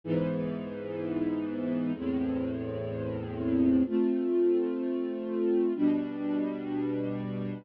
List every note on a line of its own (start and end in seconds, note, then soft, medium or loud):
0.04 1.93 G#2 medium
0.04 1.93 E3 medium
0.04 1.93 B3 medium
1.94 3.83 E2 medium
1.94 3.83 A2 medium
1.94 3.83 C4 medium
3.85 5.73 A3 medium
3.85 5.73 C4 medium
3.85 5.73 F4 medium
5.75 7.63 B2 medium
5.75 7.63 G3 medium
5.75 7.63 D4 medium